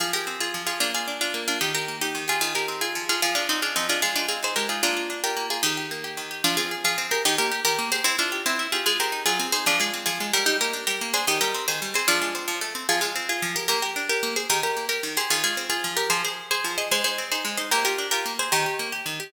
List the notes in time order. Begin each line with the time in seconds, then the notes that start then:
0.00 F3 F4 G#4
0.13 G4 G#4 A#4
0.27 C4
0.40 F4 G#4
0.54 F3
0.67 F4 G#4
0.80 A#3 D4 F4
0.94 F4 G#4
1.08 D4
1.21 D4 F4
1.34 A#3
1.48 D4 F4
1.61 D#3 D#4 G4
1.74 G4 A#4
1.88 A#3
2.01 D#4 G4
2.15 D#3
2.28 F4 G4 G#4
2.41 D#3 F4 G#4
2.55 G4 G#4 A#4
2.68 C4
2.81 F4 G#4
2.95 F3
3.09 F4 G#4
3.22 F3 F4 G#4
3.35 D4 F4 G#4
3.49 C4 D#4
3.62 D4 F4 G#4
3.76 F3 C4 D#4
3.89 D4 F4 G#4
4.02 G#3 F4 G#4
4.16 D4 D#4 F4
4.28 C4 F4 G#4
4.43 D#4 G#4 C5
4.56 G#3 G4 A#4
4.69 D#4 F4 G#4
4.83 A#3 D4 F4
4.97 F4
5.10 D4
5.24 F4 G4 A#4
5.37 A#3
5.50 F4 G#4
5.63 D#3 D#4 G4
5.77 G4
5.91 A#3
6.04 G4
6.17 D#3
6.31 G4
6.44 F3 D4 F4
6.57 C4 F4 G#4
6.71 G#4
6.84 F3 F4 G#4
6.98 C4
7.11 G4 G#4 A#4
7.25 D#3 D#4 G4
7.38 A#3 G4 A#4
7.52 G4
7.65 D#3 G4 A#4
7.79 A#3
7.92 G4 G#4 C5
8.04 C4 E4
8.18 D4 E4 F4
8.32 G4
8.46 C4 E4
8.59 E4
8.72 F4 G4 G#4
8.86 G#3 F4 G#4
9.00 C4 G4 A#4
9.12 D#4
9.26 F#3 F4 G#4
9.39 C4
9.52 D#4 G#4 C5
9.66 F3 D4 F4
9.80 G#3 F4 G#4
9.94 C4
10.06 F3 F4 G#4
10.20 G#3
10.33 G3 G4 A#4
10.46 D#4 G4
10.61 A#3 G4 A#4
10.73 D4
10.87 G3 G4 A#4
11.01 A#3
11.13 D4 G#4 C5
11.27 D#3 D#4 G4
11.41 G3 G4 A#4
11.54 C4
11.68 D#3 G#4 C5
11.82 G3
11.94 C4 G#4 C5
12.08 F3 D4 F4
12.21 G#3
12.35 C4
12.48 F3
12.61 A3
12.75 C4
12.89 F3 F4 G#4
13.01 G#3 F4 G#4
13.15 C4
13.29 F4 G#4
13.42 F3
13.56 G4 A#4
13.68 A#3 G4 A#4
13.82 G4 A#4
13.96 D4
14.09 G4 A#4
14.23 A#3
14.36 G#4 C5
14.50 D#3 G4 A#4
14.63 G4 A#4
14.77 A#3
14.89 G4 A#4
15.03 D#3
15.17 G4 G#4 C5
15.30 D#3 F4 G#4
15.44 G#3 F4 G#4
15.57 C4
15.70 F4 G#4
15.84 F3
15.97 G4 A#4
16.10 F3 G#4 C5
16.24 G#4 C5
16.51 G#4 C5
16.64 F3
16.78 G#4 C5 D#5
16.91 G#3 G#4 C5
17.04 D#4 G#4 C5
17.18 C4
17.32 D#4 G#4 C5
17.45 G#3
17.57 D#4 C5 D#5
17.71 A#3 G4 A#4
17.85 F4 G4 A#4
17.98 D4
18.11 F4 G4 A#4
18.26 A#3
18.39 G#4 C5
18.52 D#3 G4 A#4
18.66 G4
18.79 A#3
18.92 G4
19.06 D#3
19.20 G4